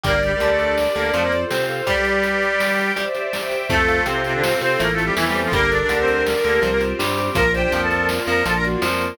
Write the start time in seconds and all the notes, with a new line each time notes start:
0.04 G1 G3 A#3 G4 A#4 D5, kick, closed hi-hat
0.23 G3 G4 D5, closed hi-hat
0.32 G3 G4
0.40 D2 D3 G3 G4, closed hi-hat
0.50 A3 A4
0.59 D4 G4 A#4 D5, closed hi-hat
0.77 G4, snare
0.95 D2 D3 A#3 A#4 D5, closed hi-hat
1.13 F2 F3 A3 F4 A4 C5, closed hi-hat
1.23 A#3 A#4
1.32 C5, closed hi-hat
1.50 C3 C4 F4 C5 F5, snare
1.69 A4, closed hi-hat
1.86 G3 G4 B4 D5, kick, closed hi-hat
2.05 D5, closed hi-hat
2.15 D5
2.23 G4, closed hi-hat
2.42 G4 B4 D5 G5, closed hi-hat
2.60 G4, snare
2.78 D5, closed hi-hat
2.96 G3 G4 C5 D5 E5, closed hi-hat
3.15 C5, closed hi-hat
3.32 G4 C5 D5 E5 G5, snare
3.51 E5, closed hi-hat
3.70 F2 A3 C4 F4 A4, kick, closed hi-hat
3.88 F5, closed hi-hat
4.06 C3 C4 A4, closed hi-hat
4.24 C3 C4 A4 C5, closed hi-hat
4.34 D3 D4
4.43 C4 A4 C5, snare
4.61 C3 C4 A4 C5, closed hi-hat
4.79 A1 A3 A#3 C4 E4 A4 A#4, closed hi-hat
4.92 A3 A4
4.98 E5, closed hi-hat
5.04 G3 G4
5.15 E2 E3 A3 C4 E4 A4, snare
5.25 G3 G4
5.34 C5, closed hi-hat
5.43 F3 F4
5.52 G1 G3 A#3 D4 G4 A4 A#4, kick, closed hi-hat
5.70 D4 A4 D5, closed hi-hat
5.81 D4 D5
5.89 D2 D3 D4 A#4 D5, closed hi-hat
5.99 C4 C5
6.08 D4 G4 A#4 D5, closed hi-hat
6.26 G4, snare
6.44 D2 D3 A#3 A4 A#4, closed hi-hat
6.62 C2 F3 C4 F4 G4 C5, closed hi-hat
6.71 A#3 A#4
6.81 C5, closed hi-hat
6.99 G2 G3 C4 F4 G4 C5, snare
7.17 G4, closed hi-hat
7.35 A#1 F3 A#3 D4 F4 A#4 A#5, kick, closed hi-hat
7.53 G4 C5 D5 G5, closed hi-hat
7.63 G4 G5
7.72 F2 F3 F4 G4 G5, closed hi-hat
7.82 A4 A5
7.89 A#3 F4 A#4, closed hi-hat
8.09 F4, snare
8.27 F2 F3 A#4 D5 A#5, closed hi-hat
8.45 A#1 F3 A#3 D4 F4 A4 A5, closed hi-hat
8.56 A#4 A#5
8.63 F#4 D5, closed hi-hat
8.81 F2 F3 A#3 F4 A#4, snare
9.00 A#4, closed hi-hat